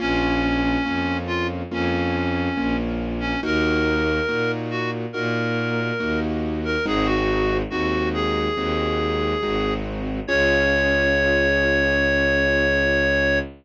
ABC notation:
X:1
M:4/4
L:1/16
Q:1/4=70
K:Db
V:1 name="Clarinet"
D6 F z D6 z D | B6 G z B6 z B | A G3 G2 A8 z2 | d16 |]
V:2 name="Acoustic Grand Piano"
[B,DF]4 [B,DF]4 [B,DF]4 [B,DF]4 | [B,EG]4 [B,EG]4 [B,EG]4 [B,EG]4 | [A,CEG]4 [A,CEG]4 [A,CEG]4 [A,CEG]4 | [DFA]16 |]
V:3 name="Violin" clef=bass
B,,,4 F,,4 F,,4 B,,,4 | E,,4 B,,4 B,,4 E,,4 | A,,,4 E,,4 E,,4 A,,,4 | D,,16 |]